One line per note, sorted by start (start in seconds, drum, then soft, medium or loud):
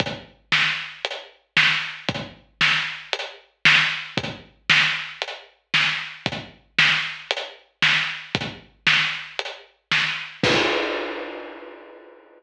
0.00 kick medium
0.00 closed hi-hat medium
0.52 snare medium
1.05 closed hi-hat medium
1.57 snare loud
2.09 kick medium
2.09 closed hi-hat medium
2.61 snare medium
3.13 closed hi-hat loud
3.65 snare loud
4.17 kick medium
4.17 closed hi-hat medium
4.70 snare loud
5.22 closed hi-hat medium
5.74 snare medium
6.26 kick medium
6.26 closed hi-hat medium
6.78 snare loud
7.31 closed hi-hat loud
7.82 snare loud
8.35 kick loud
8.35 closed hi-hat medium
8.87 snare medium
9.39 closed hi-hat medium
9.92 snare medium
10.43 kick loud
10.43 crash loud